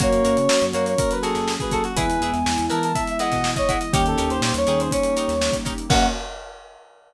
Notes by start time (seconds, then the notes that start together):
0.00 F#2 A#3 C#4 F#4 A#4 C#5, kick, closed hi-hat
0.12 closed hi-hat
0.24 F#2 F#4 A#4 C#5, closed hi-hat
0.37 C#3, closed hi-hat
0.48 F#3, snare
0.61 F#2, closed hi-hat
0.73 F#2 A#3 F#4 A#4 C#5, closed hi-hat
0.86 C#5, snare, closed hi-hat
0.98 F#3 A#3 F#4 A#4, kick, closed hi-hat
1.11 B4, closed hi-hat
1.22 F#4 G#4 A4 A#4 C#5, snare, closed hi-hat
1.35 F#2, snare, closed hi-hat
1.48 snare
1.60 G#4 B4, kick, closed hi-hat
1.71 F#4 A4 A#4 C#5, kick, closed hi-hat
1.84 F#4, closed hi-hat
1.96 E2 G#3 B3 E4 G#4 B4 G#5, kick, closed hi-hat
2.10 closed hi-hat
2.21 E2 E4 G#4 B4, closed hi-hat
2.33 E2, snare, closed hi-hat
2.46 E2, snare
2.58 E2, closed hi-hat
2.70 E3 E4 G#4 A#4 B4 A5, closed hi-hat
2.83 A5, closed hi-hat
2.95 E3 G#3 E4 E5, kick, closed hi-hat
3.07 E5, closed hi-hat
3.19 E4 G#4 B4 D#5 F#5, snare, closed hi-hat
3.32 B2, kick, snare, closed hi-hat
3.44 snare
3.56 C#5 D#5, kick, closed hi-hat
3.68 E4 G#4 B4 F#5, kick, closed hi-hat
3.81 D#5, closed hi-hat
3.93 D#2 G3 A#3 C#4 D#4 G4 A#4 C#5, kick, closed hi-hat
4.06 A4, closed hi-hat
4.18 D#2 D#4 G4 A#4 C#5, closed hi-hat
4.30 D#2 C5, closed hi-hat
4.41 A#2 C5, snare
4.54 D#2 C#5, closed hi-hat
4.67 D#2 D#4 G4 G#4 A#4 C#5, snare, closed hi-hat
4.80 C5, closed hi-hat
4.91 G3 A#3 C#4 D#4 G4 C#5, kick, closed hi-hat
5.03 closed hi-hat
5.16 D#4 G4 A#4 C#5, closed hi-hat
5.28 D#2, snare, closed hi-hat
5.41 snare
5.53 kick, snare, closed hi-hat
5.65 D#4 G4 A#4 C#5, kick, closed hi-hat
5.78 closed hi-hat
5.88 F#2 A#3 C#4 F#4 A#4 C#5 F#5, kick, crash